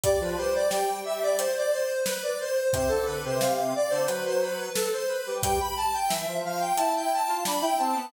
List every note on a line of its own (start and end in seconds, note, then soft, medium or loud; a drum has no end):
0.04 0.20 G3 loud
0.04 0.20 D5 loud
0.04 kick loud
0.04 closed hi-hat loud
0.20 0.36 F3 loud
0.20 0.37 B4 medium
0.37 1.48 G3 medium
0.37 0.53 C5 loud
0.55 0.71 D5 loud
0.70 0.99 G5 loud
0.70 snare loud
1.05 1.21 E5 loud
1.23 1.39 D5 loud
1.38 1.54 C5 loud
1.38 closed hi-hat loud
1.57 1.73 D5 loud
1.71 2.01 C5 loud
2.05 2.21 B4 loud
2.05 snare loud
2.23 2.39 D5 medium
2.40 2.71 C5 loud
2.73 2.89 C3 loud
2.73 2.90 C5 loud
2.73 kick loud
2.73 closed hi-hat loud
2.88 3.06 D3 medium
2.88 3.04 A4 loud
3.05 3.24 D3 medium
3.05 3.21 B4 loud
3.24 3.40 C3 medium
3.24 3.40 C5 loud
3.40 3.73 C3 loud
3.40 3.73 F5 medium
3.40 snare loud
3.75 3.91 D5 loud
3.90 4.07 D3 loud
3.90 4.06 C5 loud
4.06 4.70 F#3 medium
4.06 4.22 B4 loud
4.06 closed hi-hat loud
4.25 4.41 C5 loud
4.41 4.71 B4 loud
4.75 4.91 A4 loud
4.75 snare loud
4.92 5.08 C5 loud
5.08 5.37 B4 medium
5.26 5.42 G3 medium
5.42 5.59 G3 loud
5.42 5.58 G5 loud
5.42 kick loud
5.42 closed hi-hat loud
5.60 5.76 B5 loud
5.77 5.93 A5 loud
5.94 6.10 G5 loud
6.09 6.26 E3 loud
6.09 6.38 E5 loud
6.09 snare loud
6.27 6.43 F3 medium
6.45 6.72 F3 medium
6.45 6.61 F5 loud
6.60 6.76 G5 loud
6.76 7.20 E4 medium
6.76 6.92 A5 loud
6.76 closed hi-hat loud
6.96 7.12 G5 loud
7.13 7.43 A5 loud
7.28 7.44 F4 medium
7.45 7.62 D4 medium
7.45 7.62 B5 loud
7.45 snare loud
7.62 7.78 E4 medium
7.62 7.78 G5 loud
7.78 7.95 C4 medium
7.78 8.05 A5 medium
7.95 8.11 B3 medium